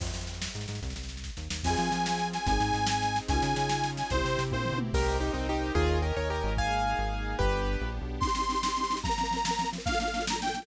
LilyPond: <<
  \new Staff \with { instrumentName = "Accordion" } { \time 6/8 \key f \minor \tempo 4. = 146 r2. | r2. | aes''2~ aes''8 aes''8 | aes''2. |
aes''2~ aes''8 aes''8 | c''4. c''4 r8 | \key c \minor r2. | r2. |
r2. | r2. | c'''2. | bes''2. |
f''8 f''4 bes''8 g''4 | }
  \new Staff \with { instrumentName = "Acoustic Grand Piano" } { \time 6/8 \key f \minor r2. | r2. | r2. | r2. |
r2. | r2. | \key c \minor <g' bes'>4 <ees' g'>8 <c' ees'>8 <ees' g'>4 | <f' aes'>4 <g' bes'>8 <bes' des''>8 <g' bes'>4 |
<f'' aes''>2. | <g' b'>2 r4 | r2. | r2. |
r2. | }
  \new Staff \with { instrumentName = "Marimba" } { \time 6/8 \key f \minor r2. | r2. | <c' f' aes'>2. | <c' ees' aes'>2. |
<des' ees' f' aes'>2. | <c' e' g'>2. | \key c \minor r2. | r2. |
r2. | r2. | <c' ees' g'>8 <c' ees' g'>8 <c' ees' g'>8 <c' ees' g'>8 <c' ees' g'>8 <c' ees' g'>8 | <f c' bes'>8 <f c' bes'>8 <f c' bes'>8 <f c' bes'>8 <f c' bes'>8 <f c' bes'>8 |
<bes d' f' a'>8 <bes d' f' a'>8 <bes d' f' a'>8 <bes d' f' a'>8 <bes d' f' a'>8 <bes d' f' a'>8 | }
  \new Staff \with { instrumentName = "Synth Bass 1" } { \clef bass \time 6/8 \key f \minor f,8 f,4. aes,8 aes,8 | c,8 c,4. ees,8 ees,8 | f,8 f8 f2 | aes,,8 aes,8 aes,2 |
des,8 des8 des2 | c,8 c8 c8 bes,8. b,8. | \key c \minor c,4. c,4. | ees,4. ees,4 aes,,8~ |
aes,,4. aes,,4. | g,,4. bes,,8. b,,8. | r2. | r2. |
r2. | }
  \new Staff \with { instrumentName = "Pad 5 (bowed)" } { \time 6/8 \key f \minor r2. | r2. | <c' f' aes'>2. | <c' ees' aes'>2. |
<des' ees' f' aes'>2. | <c' e' g'>2. | \key c \minor <bes' c'' ees'' g''>2. | <bes' des'' ees'' aes''>2. |
<bes ees' aes'>2. | <b d' g'>2. | <c' ees' g'>2. | <f bes c'>2. |
<bes, f a d'>2. | }
  \new DrumStaff \with { instrumentName = "Drums" } \drummode { \time 6/8 <cymc bd sn>16 sn16 sn16 sn16 sn16 sn16 sn16 sn16 sn16 sn16 sn16 sn16 | <bd sn>16 sn16 sn16 sn16 sn16 sn16 <bd sn>8 sn8 sn8 | <cymc bd sn>8 sn8 sn8 sn8 sn8 sn8 | <bd sn>8 sn8 sn8 sn8 sn8 sn8 |
<bd sn>8 sn8 sn8 sn8 sn8 sn8 | <bd sn>8 sn8 sn8 <bd tommh>8 tomfh8 toml8 | <cymc bd>4. r4. | bd4. r4. |
bd4. r4. | bd4. r4. | <bd sn>16 sn16 sn16 sn16 sn16 sn16 sn16 sn16 sn16 sn16 sn16 sn16 | <bd sn>16 sn16 sn16 sn16 sn16 sn16 sn16 sn16 sn16 sn16 sn16 sn16 |
<bd sn>16 sn16 sn16 sn16 sn16 sn16 sn16 sn16 sn16 sn16 sn16 sn16 | }
>>